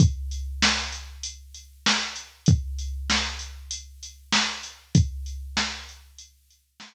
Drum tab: HH |xx-xxx-x|xx-xxx-x|xx-xxx--|
SD |--o---o-|--o---o-|--o---o-|
BD |o-------|o-------|o-------|